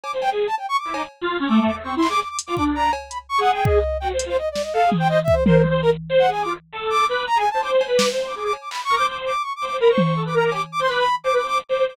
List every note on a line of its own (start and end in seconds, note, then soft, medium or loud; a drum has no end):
0.03 0.12 D6 medium
0.03 cowbell medium
0.13 0.29 C5 medium
0.22 0.30 G5 loud
0.22 cowbell medium
0.31 0.47 G#4 medium
0.47 0.55 A5 medium
0.58 0.66 G5 medium
0.58 cowbell medium
0.69 0.77 C#6 loud
0.78 0.94 D6 medium
0.85 0.93 E4 medium
0.94 1.02 D#4 medium
0.94 1.03 D6 medium
0.94 cowbell loud
1.21 1.38 F4 loud
1.40 1.48 C#4 loud
1.47 1.59 A3 loud
1.47 1.63 D6 soft
1.60 1.71 A3 loud
1.66 1.75 D6 medium
1.66 floor tom medium
1.72 1.83 A3 medium
1.84 1.95 C4 medium
1.84 1.95 C#6 medium
1.96 2.07 E4 medium
1.96 2.08 C6 medium
2.02 clap medium
2.09 2.20 G#4 medium
2.09 2.20 D6 loud
2.20 2.28 D6 medium
2.29 2.38 D6 medium
2.39 closed hi-hat loud
2.46 2.55 F4 medium
2.46 2.55 D6 medium
2.56 2.90 D4 medium
2.56 2.64 D6 medium
2.56 kick medium
2.75 2.91 A#5 loud
2.93 cowbell loud
3.10 3.18 B5 medium
3.10 closed hi-hat medium
3.29 3.40 C#6 loud
3.38 3.79 G#4 medium
3.38 3.51 F#5 loud
3.54 3.64 G5 medium
3.65 3.97 D#5 medium
3.65 kick loud
4.00 4.12 F#4 medium
4.00 4.08 G5 medium
4.13 4.24 C5 medium
4.19 closed hi-hat loud
4.26 4.36 F4 medium
4.26 4.37 C5 loud
4.38 4.49 D#5 medium
4.51 4.62 D5 medium
4.55 snare medium
4.62 4.73 D#5 medium
4.73 4.84 A4 medium
4.73 4.90 F5 loud
4.86 4.97 G#4 medium
4.92 high tom loud
4.97 5.08 C5 medium
4.97 5.08 G5 loud
5.09 5.18 C5 medium
5.09 5.20 D#5 loud
5.24 5.35 E5 loud
5.24 kick medium
5.33 5.44 C5 medium
5.46 5.62 A#4 medium
5.46 5.57 C5 medium
5.46 high tom loud
5.58 5.69 C5 medium
5.64 high tom medium
5.70 5.81 C5 loud
5.82 5.90 A#4 medium
5.82 5.91 A#4 loud
6.09 6.26 C5 loud
6.19 6.30 F#5 loud
6.28 6.44 G#4 medium
6.28 6.42 G#5 medium
6.42 6.53 F4 medium
6.42 6.53 D6 medium
6.72 7.05 A4 medium
6.90 7.06 D6 loud
7.07 7.25 B4 loud
7.07 7.23 D6 soft
7.27 7.38 A#5 loud
7.36 7.44 G#4 medium
7.36 7.49 G#5 loud
7.50 7.62 C5 medium
7.50 7.61 A5 medium
7.63 7.85 C5 loud
7.63 7.71 D6 medium
7.63 cowbell medium
7.81 cowbell loud
7.87 8.09 B4 medium
7.97 8.05 D6 medium
7.97 snare loud
8.11 8.33 C5 medium
8.27 8.35 D6 medium
8.35 8.52 G#4 medium
8.35 8.44 D6 medium
8.45 8.53 D6 medium
8.53 cowbell medium
8.61 8.69 D6 soft
8.70 8.81 B5 medium
8.70 clap medium
8.84 8.95 C#6 loud
8.89 8.98 A#4 loud
8.95 9.07 C5 medium
8.95 9.06 D6 loud
9.08 9.32 C5 medium
9.08 9.17 D6 medium
9.26 9.42 D6 medium
9.42 9.53 C#6 medium
9.56 9.65 D6 medium
9.61 9.69 C5 medium
9.65 9.76 D6 medium
9.71 9.79 C5 medium
9.80 9.91 A#4 loud
9.80 9.89 B5 medium
9.89 10.02 C5 medium
9.89 10.22 C#6 medium
9.98 high tom loud
10.04 10.14 C5 medium
10.16 10.24 A4 medium
10.25 10.33 B4 medium
10.25 10.35 D6 medium
10.34 10.51 A#4 loud
10.34 10.44 A#5 medium
10.45 10.53 D6 medium
10.52 10.60 G4 medium
10.52 10.62 D6 medium
10.52 cowbell medium
10.72 10.80 D6 loud
10.79 10.87 C5 loud
10.79 10.89 C6 medium
10.88 11.04 B4 loud
10.88 10.98 D6 medium
10.88 clap soft
10.99 11.15 B5 loud
11.24 11.32 C5 medium
11.24 11.34 D6 medium
11.24 cowbell soft
11.33 11.41 B4 medium
11.33 11.47 D6 medium
11.43 11.59 C5 medium
11.47 11.58 D6 loud
11.69 11.77 C5 medium
11.69 11.85 D6 soft
11.79 11.87 C5 medium
11.88 11.96 C5 loud
11.88 11.96 D6 medium